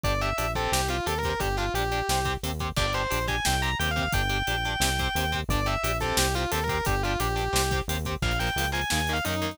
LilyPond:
<<
  \new Staff \with { instrumentName = "Distortion Guitar" } { \time 4/4 \key g \dorian \tempo 4 = 176 d''8 e''4 a'8 g'8 f'8 \tuplet 3/2 { a'8 bes'8 bes'8 } | g'8 f'8 g'2 r4 | d''8 c''4 aes''8 g''8 bes''8 \tuplet 3/2 { g''8 f''8 f''8 } | g''1 |
d''8 e''4 a'8 g'8 f'8 \tuplet 3/2 { a'8 bes'8 bes'8 } | g'8 f'8 g'2 r4 | \key bes \dorian f''8 g''4 aes''8 \tuplet 3/2 { aes''8 aes''8 f''8 } ees'8 ees'8 | }
  \new Staff \with { instrumentName = "Overdriven Guitar" } { \time 4/4 \key g \dorian <d' g'>8 <d' g'>8 <d' g'>8 <c' g'>4 <c' g'>8 <c' g'>8 <c' g'>8 | <d' g'>8 <d' g'>8 <d' g'>8 <d' g'>8 <c' g'>8 <c' g'>8 <c' g'>8 <c' g'>8 | <d' g'>8 <d' g'>8 <d' g'>8 <d' g'>8 <c' g'>8 <c' g'>8 <c' g'>8 <c' g'>8 | <d' g'>8 <d' g'>8 <d' g'>8 <d' g'>8 <c' g'>8 <c' g'>8 <c' g'>8 <c' g'>8 |
<d' g'>8 <d' g'>8 <d' g'>8 <c' g'>4 <c' g'>8 <c' g'>8 <c' g'>8 | <d' g'>8 <d' g'>8 <d' g'>8 <d' g'>8 <c' g'>8 <c' g'>8 <c' g'>8 <c' g'>8 | \key bes \dorian <f bes>8 <f bes>8 <f bes>8 <f bes>8 <ees bes>8 <ees bes>8 <ees bes>8 <ees bes>8 | }
  \new Staff \with { instrumentName = "Synth Bass 1" } { \clef bass \time 4/4 \key g \dorian g,,4 bes,,4 c,4 ees,4 | g,,4 bes,,4 c,4 ees,4 | g,,4 bes,,4 c,4 ees,4 | g,,4 bes,,4 c,4 ees,4 |
g,,4 bes,,4 c,4 ees,4 | g,,4 bes,,4 c,4 ees,4 | \key bes \dorian bes,,4 des,4 ees,4 ges,4 | }
  \new DrumStaff \with { instrumentName = "Drums" } \drummode { \time 4/4 <hh bd>8 hh8 hh8 <hh bd>8 sn8 hh8 hh8 <hh bd>8 | <hh bd>8 hh8 hh8 hh8 sn8 <hh bd>8 hh8 <hh bd>8 | <cymc bd>8 hh8 hh8 <hh bd>8 sn8 hh8 hh8 <hh bd>8 | <hh bd>8 hh8 hh8 hh8 sn8 <hh bd>8 hh8 <hh bd>8 |
<hh bd>8 hh8 hh8 <hh bd>8 sn8 hh8 hh8 <hh bd>8 | <hh bd>8 hh8 hh8 hh8 sn8 <hh bd>8 hh8 <hh bd>8 | <cymc bd>16 hh16 hh16 hh16 hh16 hh16 hh16 hh16 sn16 hh16 hh16 hh16 hh16 hh16 hh16 hh16 | }
>>